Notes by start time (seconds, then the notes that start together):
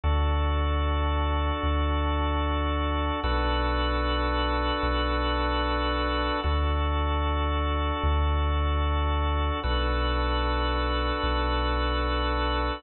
0.04 D2 D4 F#4 A4
1.63 D2
3.24 B1 D4 F#4 A4 B4
4.83 B1
6.44 D2 D4 F#4 A4
8.03 D2
9.63 B1 D4 F#4 A4 B4
11.23 B1